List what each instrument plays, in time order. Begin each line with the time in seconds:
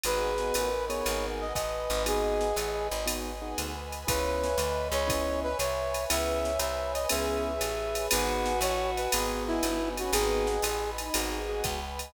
0.03 electric bass (finger) G#1, acoustic grand piano B3 D#4 F#4 G#4, choir aahs G#4, pad 5 (bowed) B4 D#5 F#5 G#5, brass section B4, ride
0.38 acoustic grand piano B3 D#4 F#4 G#4, snare
0.54 electric bass (finger) A1, choir aahs A#4, pad 5 (bowed) B4 D#5 G#5 B5, hi-hat pedal, ride
0.88 acoustic grand piano B3 D#4 F#4 G#4, brass section C#5, ride
1.05 electric bass (finger) G#1, pad 5 (bowed) B4 D#5 F#5 G#5, ride
1.41 brass section D#5
1.54 electric bass (finger) A1, choir aahs B4, pad 5 (bowed) B4 D#5 G#5 B5, brass section D#5, kick, hi-hat pedal, ride
1.90 electric bass (finger) G#1, ride
2.06 acoustic grand piano B3 D#4 F#4 G#4, brass section G#4, pad 5 (bowed) B4 D#5 F#5 G#5, choir aahs D#5, ride
2.41 snare
2.56 electric bass (finger) A1, pad 5 (bowed) B4 D#5 G#5 B5, choir aahs D#5, hi-hat pedal, ride
2.91 electric bass (finger) G#1, ride
3.06 acoustic grand piano B3 D#4 F#4 G#4, pad 5 (bowed) B4 D#5 F#5 G#5, ride
3.42 acoustic grand piano B3 D#4 F#4 G#4
3.57 electric bass (finger) D2, pad 5 (bowed) B4 D#5 G#5 B5, hi-hat pedal, ride
3.92 ride
4.07 electric bass (finger) C#2, acoustic grand piano B3 C#4 E4 G#4, brass section B4, pad 5 (bowed) B4 C#5 E5 G#5, choir aahs C#5, kick, ride
4.43 snare
4.58 electric bass (finger) D2, pad 5 (bowed) B4 C#5 G#5 B5, choir aahs D#5, hi-hat pedal, ride
4.91 electric bass (finger) C#2, brass section C#5, ride
5.07 acoustic grand piano B3 C#4 E4 G#4, pad 5 (bowed) B4 C#5 E5 G#5, kick, ride
5.43 brass section B4
5.59 electric bass (finger) C2, pad 5 (bowed) B4 C#5 G#5 B5, brass section C#5, choir aahs E5, hi-hat pedal, ride
5.94 ride
6.10 electric bass (finger) C#2, acoustic grand piano B3 C#4 E4 G#4, choir aahs B4, pad 5 (bowed) B4 C#5 E5 G#5, brass section E5, ride
6.45 choir aahs C#5, snare
6.59 electric bass (finger) C2, pad 5 (bowed) B4 C#5 G#5 B5, brass section E5, hi-hat pedal, ride
6.94 brass section D#5, ride
7.09 electric bass (finger) C#2, acoustic grand piano B3 C#4 E4 G#4, choir aahs G#4, pad 5 (bowed) B4 C#5 E5 G#5, brass section E5, ride
7.45 choir aahs G#4
7.61 electric bass (finger) A1, pad 5 (bowed) B4 C#5 G#5 B5, hi-hat pedal, ride
7.95 ride
8.10 electric bass (finger) G#1, acoustic grand piano B3 D#4 F#4 G#4, choir aahs F#4, brass section B4, pad 5 (bowed) B4 D#5 F#5 G#5, ride
8.46 snare
8.61 electric bass (finger) A1, pad 5 (bowed) B4 D#5 G#5 B5, brass section C#5, hi-hat pedal, ride
8.97 brass section B4, ride
9.12 electric bass (finger) G#1, choir aahs B3, acoustic grand piano B3 D#4 F#4 G#4, pad 5 (bowed) B4 D#5 F#5 G#5, ride
9.47 brass section E4
9.63 electric bass (finger) G1, acoustic grand piano B3 D#4 F#4 G#4, pad 5 (bowed) B4 D#5 G#5 B5, hi-hat pedal, ride
9.96 choir aahs C#4, brass section F#4, ride
10.12 electric bass (finger) G#1, acoustic grand piano B3 D#4 F#4 G#4, choir aahs B3, brass section G#4, pad 5 (bowed) B4 D#5 F#5 G#5, ride
10.47 snare
10.62 electric bass (finger) A1, pad 5 (bowed) B4 D#5 G#5 B5, hi-hat pedal, ride
10.98 choir aahs D#4, ride
11.14 electric bass (finger) G#1, acoustic grand piano B3 D#4 F#4 G#4, choir aahs G#4, pad 5 (bowed) B4 D#5 F#5 G#5, ride
11.49 acoustic grand piano B3 D#4 F#4 G#4
11.64 electric bass (finger) C#2, pad 5 (bowed) B4 D#5 G#5 B5, kick, hi-hat pedal, ride
11.99 ride